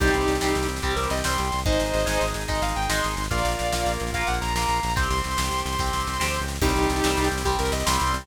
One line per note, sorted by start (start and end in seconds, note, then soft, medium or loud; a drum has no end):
0.00 0.10 C2 loud
0.00 0.37 G3 medium
0.00 1.49 C4 medium
0.00 0.37 C4 medium
0.00 0.66 D#4 medium
0.00 0.66 G4 medium
0.00 1.49 G4 medium
0.00 kick medium
0.00 snare medium
0.00 crash medium
0.07 snare medium
0.14 0.26 C2 medium
0.14 snare medium
0.21 snare medium
0.28 0.39 C2 medium
0.28 snare medium
0.35 snare medium
0.41 0.54 C2 medium
0.41 0.79 G3 medium
0.41 0.79 C4 medium
0.41 snare medium
0.48 snare medium
0.55 0.67 C2 medium
0.55 snare medium
0.63 snare medium
0.69 0.80 C2 medium
0.69 snare medium
0.76 snare medium
0.82 0.94 C2 medium
0.82 1.20 G3 medium
0.82 1.20 C4 medium
0.82 0.94 G4 medium
0.82 kick medium
0.82 snare medium
0.90 snare medium
0.96 1.08 C2 medium
0.96 1.08 A#4 medium
0.96 snare medium
1.03 snare medium
1.10 1.23 C2 medium
1.10 1.23 D#5 medium
1.10 snare medium
1.17 snare medium
1.24 1.37 C2 medium
1.24 1.62 G3 medium
1.24 1.62 C4 medium
1.24 1.60 C6 medium
1.24 snare loud
1.31 snare medium
1.38 1.51 C2 medium
1.38 snare medium
1.45 snare medium
1.52 1.65 C2 medium
1.52 snare medium
1.59 snare medium
1.66 1.78 G#1 medium
1.66 2.03 G#3 medium
1.66 3.14 D#4 medium
1.66 2.03 D#4 medium
1.66 3.14 G#4 medium
1.66 2.26 C5 medium
1.66 2.26 D#5 medium
1.66 kick loud
1.66 snare medium
1.72 snare medium
1.80 1.92 G#1 medium
1.80 snare medium
1.86 snare medium
1.94 2.05 G#1 medium
1.94 snare medium
2.00 snare medium
2.06 2.18 G#1 medium
2.06 2.43 G#3 medium
2.06 2.43 D#4 medium
2.06 snare medium
2.13 snare medium
2.21 2.33 G#1 medium
2.21 snare medium
2.28 snare medium
2.34 2.47 G#1 medium
2.34 snare medium
2.41 snare medium
2.48 2.61 G#1 medium
2.48 2.86 G#3 medium
2.48 2.86 D#4 medium
2.48 2.62 D#5 medium
2.48 kick medium
2.48 snare medium
2.55 snare medium
2.62 2.74 G#1 medium
2.62 2.75 F5 medium
2.62 snare medium
2.69 snare medium
2.76 2.88 G#1 medium
2.76 2.89 G5 medium
2.76 snare medium
2.82 snare medium
2.89 3.01 G#1 medium
2.89 3.27 G#3 medium
2.89 3.27 D#4 medium
2.89 3.23 C6 medium
2.89 snare loud
2.96 snare medium
3.04 3.16 G#1 medium
3.04 snare medium
3.11 snare medium
3.17 3.29 G#1 medium
3.17 snare medium
3.24 snare medium
3.31 3.43 A#1 loud
3.31 3.68 A#3 medium
3.31 4.80 F4 medium
3.31 3.68 F4 loud
3.31 4.80 A#4 medium
3.31 3.93 D5 medium
3.31 3.93 F5 medium
3.31 kick medium
3.31 snare medium
3.38 snare medium
3.45 3.56 A#1 medium
3.45 snare medium
3.52 snare medium
3.59 3.72 A#1 medium
3.59 snare medium
3.65 snare soft
3.72 3.85 A#1 medium
3.72 4.11 A#3 medium
3.72 4.11 F4 medium
3.72 snare medium
3.79 snare soft
3.86 3.98 A#1 medium
3.86 snare medium
3.93 snare medium
4.00 4.12 A#1 medium
4.00 snare medium
4.07 snare medium
4.12 4.24 A#1 medium
4.12 4.52 A#3 medium
4.12 4.52 F4 medium
4.12 4.27 F5 medium
4.12 kick medium
4.12 snare medium
4.21 snare medium
4.27 4.40 A#1 medium
4.27 4.39 F#5 medium
4.27 snare medium
4.34 snare medium
4.41 4.54 A#1 medium
4.41 4.54 A#5 medium
4.41 snare medium
4.48 snare medium
4.54 4.66 A#1 medium
4.54 4.94 A#3 medium
4.54 4.94 F4 medium
4.54 4.93 A#5 medium
4.54 snare medium
4.61 snare medium
4.68 4.80 A#1 medium
4.68 snare medium
4.76 snare medium
4.83 4.95 A#1 medium
4.83 snare medium
4.90 snare medium
4.96 5.08 C2 medium
4.96 5.33 C4 medium
4.96 6.46 G4 medium
4.96 5.33 G4 medium
4.96 6.46 C5 medium
4.96 5.09 C6 medium
4.96 kick medium
4.96 snare medium
5.03 snare medium
5.10 5.22 C2 medium
5.10 5.61 C6 medium
5.10 snare medium
5.17 snare medium
5.24 5.37 C2 medium
5.24 snare medium
5.31 snare medium
5.37 5.50 C2 medium
5.37 5.74 C4 medium
5.37 5.74 G4 medium
5.37 snare loud
5.45 snare medium
5.51 5.63 C2 medium
5.51 snare medium
5.58 snare medium
5.65 5.77 C2 medium
5.65 6.39 C6 medium
5.65 snare medium
5.73 snare medium
5.79 5.91 C2 medium
5.79 6.17 C4 medium
5.79 6.17 G4 medium
5.79 kick medium
5.79 snare medium
5.86 snare medium
5.93 6.05 C2 medium
5.93 snare medium
6.00 snare medium
6.07 6.19 C2 medium
6.07 snare medium
6.13 snare medium
6.20 6.39 D2 medium
6.20 6.57 C4 medium
6.20 6.57 G4 medium
6.20 snare loud
6.27 snare medium
6.34 snare medium
6.40 6.59 C#2 medium
6.40 snare medium
6.48 snare medium
6.55 snare medium
6.61 6.73 C2 loud
6.61 7.00 G3 loud
6.61 8.11 C4 loud
6.61 7.00 C4 medium
6.61 7.28 D#4 medium
6.61 7.28 G4 medium
6.61 8.11 G4 loud
6.61 kick medium
6.61 snare medium
6.61 crash medium
6.69 snare medium
6.76 6.87 C2 medium
6.76 snare medium
6.83 snare medium
6.90 7.02 C2 medium
6.90 snare medium
6.96 snare medium
7.04 7.16 C2 medium
7.04 7.42 G3 medium
7.04 7.42 C4 medium
7.04 snare loud
7.10 snare medium
7.17 7.29 C2 loud
7.17 snare medium
7.24 snare medium
7.31 7.44 C2 medium
7.31 snare medium
7.38 snare medium
7.45 7.57 C2 medium
7.45 7.83 G3 medium
7.45 7.83 C4 medium
7.45 7.57 G4 medium
7.45 kick medium
7.45 snare medium
7.52 snare medium
7.59 7.71 C2 medium
7.59 7.71 A#4 medium
7.59 snare medium
7.65 snare medium
7.72 7.83 C2 medium
7.72 7.85 D#5 medium
7.72 snare medium
7.80 snare medium
7.86 7.98 C2 medium
7.86 8.24 G3 medium
7.86 8.24 C4 medium
7.86 8.21 C6 medium
7.86 snare loud
7.93 snare medium
8.00 8.13 C2 loud
8.00 snare medium
8.07 snare medium
8.13 8.25 C2 medium
8.13 snare medium
8.21 snare medium